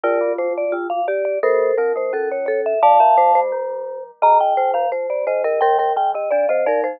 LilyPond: <<
  \new Staff \with { instrumentName = "Vibraphone" } { \time 2/2 \key f \major \tempo 2 = 86 <bes' d''>4 c''8 d''8 f'8 f''8 d''8 d''8 | <a' c''>4 bes'8 c''8 a'8 cis''8 cis''8 e''8 | <f'' a''>2 r2 | \key ees \major bes''8 g''4 f''8 r8 d''8 ees''8 ees''8 |
g''8 g''8 g''8 ees''8 d''8 c''8 bes'8 r8 | }
  \new Staff \with { instrumentName = "Marimba" } { \time 2/2 \key f \major f'2. g'4 | bes'2. a'4 | d''8 e''8 c''8 c''2 r8 | \key ees \major ees''4 c''4 c''4 c''8 bes'8 |
bes'8 bes'8 r4 d''8 ees''8 d''8 c''8 | }
  \new Staff \with { instrumentName = "Glockenspiel" } { \time 2/2 \key f \major d8 c8 c4 d8 c8 r4 | bes4 c'8 bes8 cis'2 | a8 f8 a4 f2 | \key ees \major ees4 ees8 f8 r4 ees8 d8 |
g4 ees8 d8 d'8 c'8 ees'4 | }
  \new Staff \with { instrumentName = "Vibraphone" } { \clef bass \time 2/2 \key f \major f,8 g,8 f,2~ f,8 r8 | g,4 f,2. | f,4 f,8 g,2 r8 | \key ees \major g,8 f,8 f,4 f,8 g,8 ees,4 |
ees2 f4 f8 f8 | }
>>